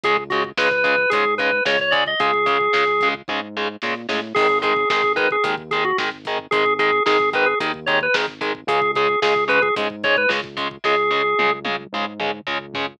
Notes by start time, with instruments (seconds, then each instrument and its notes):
0.03 synth bass 1 C#2, overdriven guitar C#3 G#3, drawbar organ G#4, kick, closed hi-hat
0.17 kick
0.30 overdriven guitar C#3 G#3, drawbar organ F#4, kick, closed hi-hat
0.44 kick
0.57 synth bass 1 C#2, overdriven guitar C#3 G#3, drawbar organ B4, kick, snare
0.71 drawbar organ B4, kick
0.84 overdriven guitar C#3 G#3, kick, closed hi-hat
0.98 kick
1.10 synth bass 1 G#2, overdriven guitar C#3 G#3, drawbar organ G#4, kick, closed hi-hat
1.26 kick
1.38 overdriven guitar C#3 G#3, drawbar organ B4, kick, closed hi-hat
1.52 kick
1.65 synth bass 1 C#2, overdriven guitar C#3 G#3, drawbar organ C#5, kick, snare
1.80 drawbar organ C#5, kick
1.91 overdriven guitar C#3 G#3, drawbar organ D5, kick, closed hi-hat
2.06 drawbar organ D#5, kick
2.20 synth bass 1 C#2, overdriven guitar C#3 G#3, drawbar organ G#4, kick, closed hi-hat
2.34 kick
2.46 overdriven guitar C#3 G#3, kick, closed hi-hat
2.61 kick
2.73 synth bass 1 C#2, overdriven guitar C#3 G#3, kick, snare
2.87 kick
3.01 overdriven guitar C#3 G#3, kick, closed hi-hat
3.14 kick
3.28 synth bass 1 G#2, overdriven guitar C#3 G#3, kick
3.57 overdriven guitar C#3 G#3
3.82 synth bass 1 A#2, overdriven guitar C#3 G#3, snare
4.09 synth bass 1 A2, overdriven guitar C#3 G#3, snare
4.35 synth bass 1 G#1, overdriven guitar D#3 G#3, drawbar organ G#4, kick, crash
4.49 kick
4.62 overdriven guitar D#3 G#3, drawbar organ G#4, kick, closed hi-hat
4.76 kick
4.89 synth bass 1 G#1, overdriven guitar D#3 G#3, drawbar organ G#4, kick, snare
5.03 kick
5.16 overdriven guitar D#3 G#3, drawbar organ B4, kick, closed hi-hat
5.31 drawbar organ G#4, kick
5.44 synth bass 1 D#2, overdriven guitar D#3 G#3, kick, closed hi-hat
5.58 kick
5.71 overdriven guitar D#3 G#3, drawbar organ G#4, kick, closed hi-hat
5.85 drawbar organ F#4, kick
5.98 synth bass 1 G#1, overdriven guitar D#3 G#3, kick, snare
6.12 kick
6.25 overdriven guitar D#3 G#3, kick, closed hi-hat
6.39 kick
6.51 synth bass 1 G#1, overdriven guitar D#3 G#3, drawbar organ G#4, kick, closed hi-hat
6.66 kick
6.79 overdriven guitar D#3 G#3, drawbar organ G#4, kick, closed hi-hat
6.93 kick
7.06 synth bass 1 G#1, overdriven guitar D#3 G#3, drawbar organ G#4, kick, snare
7.20 kick
7.33 overdriven guitar D#3 G#3, drawbar organ B4, kick, closed hi-hat
7.46 drawbar organ G#4, kick
7.60 synth bass 1 D#2, overdriven guitar D#3 G#3, kick, closed hi-hat
7.74 kick
7.86 overdriven guitar D#3 G#3, drawbar organ C#5, kick, closed hi-hat
8.01 drawbar organ B4, kick
8.14 synth bass 1 G#1, overdriven guitar D#3 G#3, kick, snare
8.28 kick
8.41 overdriven guitar D#3 G#3, kick, closed hi-hat
8.55 kick
8.67 synth bass 1 C#2, overdriven guitar C#3 G#3, drawbar organ G#4, kick, closed hi-hat
8.82 kick
8.95 overdriven guitar C#3 G#3, drawbar organ G#4, kick, closed hi-hat
9.09 kick
9.22 synth bass 1 C#2, overdriven guitar C#3 G#3, drawbar organ G#4, kick, snare
9.36 kick
9.48 overdriven guitar C#3 G#3, drawbar organ B4, kick, closed hi-hat
9.62 drawbar organ G#4, kick
9.76 synth bass 1 G#2, overdriven guitar C#3 G#3, kick, closed hi-hat
9.90 kick
10.03 overdriven guitar C#3 G#3, drawbar organ C#5, kick, closed hi-hat
10.17 drawbar organ B4, kick
10.29 synth bass 1 C#2, overdriven guitar C#3 G#3, kick, snare
10.44 kick
10.57 overdriven guitar C#3 G#3, kick, closed hi-hat
10.71 kick
10.84 synth bass 1 C#2, overdriven guitar C#3 G#3, drawbar organ G#4, kick, snare
11.11 overdriven guitar C#3 G#3
11.39 synth bass 1 C#2, overdriven guitar C#3 G#3, high tom
11.65 overdriven guitar C#3 G#3, high tom
11.92 synth bass 1 G#2, overdriven guitar C#3 G#3
12.20 overdriven guitar C#3 G#3, mid tom
12.47 synth bass 1 C#2, overdriven guitar C#3 G#3, floor tom
12.74 overdriven guitar C#3 G#3, floor tom